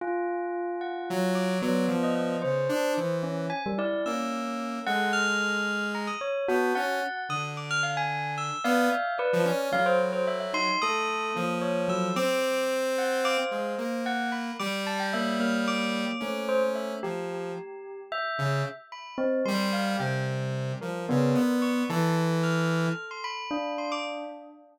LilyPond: <<
  \new Staff \with { instrumentName = "Tubular Bells" } { \time 9/8 \tempo 4. = 74 r4. ges''4 d'''4~ d'''16 ees''16 ees''8 | r2 r8 d''8 e'''4. | ges''8 f'''4. bes''16 ees'''16 des''8 r4. | ees'''16 r16 d'''16 f'''16 f''16 aes''8. e'''8 f''4 b'8 r8 |
f''16 c''16 r16 c''16 e''16 e''16 c'''8 ees'''4. des''8 e'''8 | d'''4 r4 d'''16 c''16 c''4 ges''8 b''8 | d'''8 a''16 g''16 e''8 f'''8 d'''4. c''16 r16 e''8 | r2. r8 b''8 r8 |
c'''8 f''8 g''8 r4 bes'4. des'''8 | a''8 r8 f'''4~ f'''16 c'''16 b''4 c'''16 d'''16 r8 | }
  \new Staff \with { instrumentName = "Lead 2 (sawtooth)" } { \time 9/8 r2 ges4 ges8 f4 | des8 d'8 e4 r4 bes4. | aes2~ aes8 r8 b8 des'8 r8 | d2~ d8 b8 r8. f16 des'8 |
ges2 a4 f4. | c'2~ c'8 aes8 bes4. | g2. des'4. | f4 r4. des8 r4. |
g4 c4. f8 des8 b4 | e2 r2 r8 | }
  \new Staff \with { instrumentName = "Tubular Bells" } { \time 9/8 f'2. b4. | c''4. des'8 aes''16 g16 e'8 des'4. | a'4. r4. ges'8 ges''4 | r2 r8 d''8 e''8 d''4 |
ges4. ees'8 a'4 bes4 ges8 | r4. ges''8 f''4 r4. | r4 bes8 bes4. a4. | g'2 e''4 r4 c'8 |
g2. b4. | a'2. d'4. | }
>>